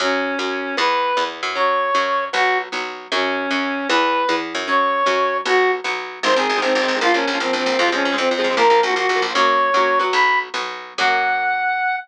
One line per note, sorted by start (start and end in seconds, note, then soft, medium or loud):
0.00 0.35 F#2 loud
0.00 0.35 F#3 loud
0.00 0.35 C#4 loud
0.00 0.76 C#4 medium
0.39 0.74 F#2 medium
0.39 0.74 F#3 medium
0.39 0.74 C#4 medium
0.77 1.13 E2 loud
0.77 1.12 E3 loud
0.77 1.12 B3 loud
0.77 1.24 B4 loud
1.17 1.42 E2 medium
1.17 1.52 E3 medium
1.17 1.52 B3 medium
1.43 1.91 F#2 loud
1.55 1.90 F#3 loud
1.55 1.90 C#4 loud
1.55 2.25 C#5 loud
1.94 2.30 F#2 medium
1.94 2.29 F#3 medium
1.94 2.29 C#4 medium
2.33 2.69 B1 loud
2.33 2.68 F#3 loud
2.33 2.68 B3 loud
2.33 2.58 F#4 loud
2.72 3.08 B1 medium
2.72 3.07 F#3 medium
2.72 3.07 B3 medium
3.12 3.47 F#2 loud
3.12 3.47 F#3 loud
3.12 3.47 C#4 loud
3.12 3.88 C#4 loud
3.51 3.86 F#2 medium
3.51 3.86 F#3 medium
3.51 3.86 C#4 medium
3.89 4.25 E2 loud
3.89 4.24 E3 loud
3.89 4.24 B3 loud
3.89 4.36 B4 loud
4.29 4.53 E2 medium
4.29 4.64 E3 medium
4.29 4.64 B3 medium
4.55 5.03 F#2 loud
4.68 5.03 F#3 loud
4.68 5.03 C#4 loud
4.68 5.37 C#5 loud
5.06 5.42 F#2 medium
5.06 5.41 F#3 loud
5.06 5.41 C#4 loud
5.45 5.81 B1 loud
5.45 5.81 F#3 loud
5.45 5.81 B3 loud
5.45 5.71 F#4 loud
5.84 6.19 B1 medium
5.84 6.19 F#3 medium
5.84 6.19 B3 medium
6.23 6.34 G#1 loud
6.23 6.29 D#3 loud
6.23 6.29 G#3 loud
6.23 6.29 C4 loud
6.23 6.36 C5 loud
6.30 6.35 D#3 medium
6.30 6.35 G#3 medium
6.30 6.35 C4 medium
6.36 6.47 G#1 medium
6.36 6.52 D#3 medium
6.36 6.52 G#3 medium
6.36 6.52 C4 medium
6.36 6.59 G#4 medium
6.49 6.60 G#1 medium
6.56 6.61 D#3 medium
6.56 6.61 G#3 medium
6.56 6.61 C4 medium
6.61 6.73 G#1 medium
6.61 6.78 D#3 medium
6.61 6.78 G#3 medium
6.61 6.74 C4 loud
6.61 6.78 C4 medium
6.75 6.86 G#1 loud
6.75 6.97 C4 medium
6.82 6.92 D#3 medium
6.82 6.92 G#3 medium
6.82 6.92 C4 medium
6.88 6.99 G#1 medium
6.95 7.00 D#3 medium
6.95 7.00 G#3 medium
6.95 7.00 C4 medium
7.01 7.12 A#1 loud
7.01 7.07 F3 loud
7.01 7.07 A#3 loud
7.01 7.14 F4 loud
7.07 7.12 F3 medium
7.07 7.12 A#3 medium
7.14 7.25 A#1 medium
7.14 7.30 F3 medium
7.14 7.30 A#3 medium
7.14 7.38 C#4 medium
7.27 7.38 A#1 medium
7.33 7.39 F3 medium
7.33 7.39 A#3 medium
7.40 7.51 A#1 medium
7.40 7.56 F3 medium
7.40 7.56 A#3 medium
7.40 7.53 C4 medium
7.53 7.64 A#1 medium
7.53 7.79 C4 medium
7.60 7.70 F3 medium
7.60 7.70 A#3 medium
7.66 7.77 A#1 medium
7.72 7.78 F3 medium
7.72 7.78 A#3 medium
7.78 7.90 F2 loud
7.78 7.84 F3 medium
7.78 7.84 G#3 loud
7.78 7.84 C4 medium
7.78 7.88 F4 loud
7.86 7.91 F3 medium
7.86 7.91 G#3 medium
7.86 7.91 C4 medium
7.92 8.03 F2 medium
7.92 8.08 F3 medium
7.92 8.08 G#3 medium
7.92 8.08 C4 medium
7.92 8.16 C#4 loud
8.05 8.16 F2 medium
8.12 8.18 F3 medium
8.12 8.17 G#3 medium
8.12 8.17 C4 medium
8.18 8.29 F2 loud
8.18 8.33 F3 medium
8.18 8.33 G#3 medium
8.18 8.33 C4 medium
8.18 8.29 C4 medium
8.31 8.42 F2 medium
8.31 8.57 C4 medium
8.38 8.48 F3 loud
8.38 8.48 G#3 loud
8.38 8.48 C4 medium
8.44 8.55 F2 medium
8.50 8.55 F3 medium
8.50 8.55 G#3 medium
8.50 8.55 C4 medium
8.56 8.68 A#1 loud
8.56 8.62 F3 loud
8.56 8.62 A#3 loud
8.56 8.80 A#4 loud
8.63 8.69 F3 medium
8.63 8.69 A#3 medium
8.70 8.81 A#1 medium
8.70 8.85 F3 medium
8.70 8.85 A#3 medium
8.83 8.94 A#1 loud
8.83 8.94 F#4 medium
8.90 8.95 F3 medium
8.90 8.95 A#3 medium
8.96 9.07 A#1 medium
8.96 9.11 F3 medium
8.96 9.11 A#3 medium
8.96 9.21 F#4 medium
9.09 9.20 A#1 medium
9.16 9.26 F3 medium
9.16 9.26 A#3 medium
9.22 9.33 A#1 medium
9.29 9.34 F3 medium
9.29 9.34 A#3 medium
9.34 9.70 F#2 loud
9.34 9.70 F#3 loud
9.34 9.70 A#3 loud
9.34 9.70 C#4 loud
9.34 9.99 C#5 loud
9.74 10.09 F#2 medium
9.74 9.99 F#3 loud
9.74 9.99 A#3 medium
9.74 9.99 C#4 medium
9.99 10.49 F#3 loud
9.99 10.49 B3 loud
10.13 10.49 B1 loud
10.13 10.39 B5 loud
10.54 10.94 B1 medium
10.54 10.94 F#3 medium
10.54 10.94 B3 loud
10.98 11.96 F#2 loud
10.98 11.97 F#3 loud
10.98 11.97 A#3 loud
10.98 11.97 C#4 loud
10.98 11.96 F#5 loud